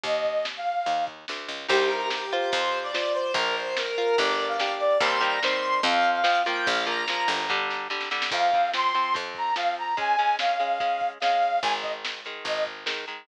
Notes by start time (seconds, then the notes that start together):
0.04 D#2 D#5, kick, closed hi-hat
0.24 kick, closed hi-hat
0.45 snare
0.57 F5
0.66 closed hi-hat
0.86 D#2, kick, closed hi-hat
1.07 kick, closed hi-hat
1.28 D2, snare
1.49 C#2, closed hi-hat
1.69 C2 D#4 G4 C5, kick, crash
1.79 closed hi-hat
1.90 A#4, closed hi-hat
2.01 closed hi-hat
2.10 G4, snare
2.22 closed hi-hat
2.32 F4 C5, closed hi-hat
2.43 closed hi-hat
2.52 F2 C5, kick, closed hi-hat
2.63 closed hi-hat
2.73 closed hi-hat
2.83 D5, closed hi-hat
2.94 F4 C5, snare
3.05 closed hi-hat
3.14 C5, closed hi-hat
3.26 closed hi-hat
3.34 A#1 F4 A#4, kick, closed hi-hat
3.45 closed hi-hat
3.56 C5, closed hi-hat
3.66 closed hi-hat
3.77 A#4, snare
3.87 closed hi-hat
3.98 F4 A#4, closed hi-hat
4.07 closed hi-hat
4.18 G1 D4 G4 D5, kick, closed hi-hat
4.28 closed hi-hat
4.39 closed hi-hat
4.48 F5, closed hi-hat
4.60 D4 G4, snare
4.70 closed hi-hat
4.80 D5, closed hi-hat
4.90 closed hi-hat
5.00 D#2 D#3 G3 C4 C6, kick, closed hi-hat
5.11 closed hi-hat
5.20 D#3 G3 C4 A#5, closed hi-hat
5.32 closed hi-hat
5.43 D#3 G3 C4 C6, snare
5.53 closed hi-hat
5.63 closed hi-hat
5.74 closed hi-hat
5.83 F2 F3 C4 F5, kick, closed hi-hat
5.94 closed hi-hat
6.05 closed hi-hat
6.15 F5, closed hi-hat
6.24 F3 C4, snare
6.36 closed hi-hat
6.45 F3 A#3 G5, closed hi-hat
6.56 closed hi-hat
6.66 A#1 F5, kick, closed hi-hat
6.77 closed hi-hat
6.86 F3 A#3 A#5, closed hi-hat
6.98 closed hi-hat
7.08 F3 A#3, snare
7.18 closed hi-hat
7.28 G1, closed hi-hat
7.39 closed hi-hat
7.49 D3 G3, kick, snare
7.71 snare
7.90 D3 G3, snare
8.01 snare
8.11 D3 G3, snare
8.22 snare
8.31 F2 F3 C4 F5, kick, crash
8.52 F3 C4, kick, closed hi-hat
8.74 F3 C4 C6, snare
8.94 F3 C4, closed hi-hat
9.14 F2 F3 C4, kick, closed hi-hat
9.35 A#5, kick, closed hi-hat
9.56 F3 C4 F5, snare
9.76 A#5, closed hi-hat
9.97 G#3 C#4 G#5, kick, closed hi-hat
10.18 G#3 C#4, closed hi-hat
10.39 G#3 C#4 F5, snare
10.60 G#3 C#4, closed hi-hat
10.80 G#3 C#4, kick, closed hi-hat
11.00 kick, closed hi-hat
11.20 G#3 C#4 F5, snare
11.42 closed hi-hat
11.63 G#1 D#3 G#3 G#5, kick, closed hi-hat
11.82 D#5, kick, closed hi-hat
12.05 snare
12.25 D#3 G#3, closed hi-hat
12.45 G#1 D#3 G#3 D#5, kick, closed hi-hat
12.66 kick, closed hi-hat
12.86 D#3 G#3, snare
13.08 D#3 G#3, closed hi-hat